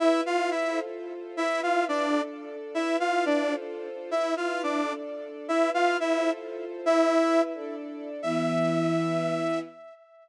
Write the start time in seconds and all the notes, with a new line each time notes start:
0.00 E4 B4 E5
0.26 F4 F5
0.51 E4 E5
0.69 F4 A4 C5
1.37 E4 B4 E5
1.63 F4 F5
1.88 D4 D5
2.06 D4 A4 D5
2.74 E4 B4 E5
3.00 F4 F5
3.26 D4 D5
3.43 F4 A4 C5
4.11 E4 B4 E5
4.37 F4 F5
4.63 D4 D5
4.80 D4 A4 D5
5.48 E4 B4 E5
5.74 F4 F5
6.00 E4 E5
6.17 F4 A4 C5
6.86 E4 B4 E5
7.54 D4 A4 D5
8.22 E3 B3 E4 E5